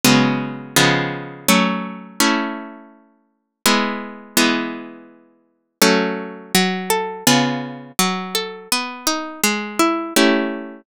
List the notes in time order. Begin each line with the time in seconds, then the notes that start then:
0.04 C#3 F#3 G#3 B3
0.76 C#3 F3 G#3 B3
1.48 F#3 A3 C#4
2.20 A3 C#4 E4
3.66 G#3 B3 E4
4.37 E3 G#3 B3
5.82 F#3 A3 C#4
6.55 F#3
6.90 A4
7.27 C#3 B3 F4 G#4
7.99 F#3
8.35 A4
8.72 B3
9.07 D#4
9.44 G#3
9.79 E4
10.16 A3 C#4 E4 G4